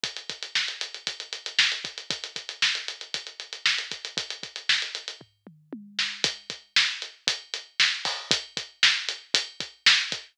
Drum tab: HH |xxxx-xxxxxxx-xxx|xxxx-xxxxxxx-xxx|xxxx-xxx--------|x-x---x-x-x---o-|
SD |----o-------o---|----o-------o---|----o---------o-|----o-------o---|
T1 |----------------|----------------|------------o---|----------------|
T2 |----------------|----------------|----------o-----|----------------|
FT |----------------|----------------|--------o-------|----------------|
BD |o-o-----o-----o-|o-o-----o-----o-|o-o-----o-------|o-o-----o-----o-|

HH |x-x---x-x-x---x-|
SD |----o-------o---|
T1 |----------------|
T2 |----------------|
FT |----------------|
BD |o-o-----o-o---o-|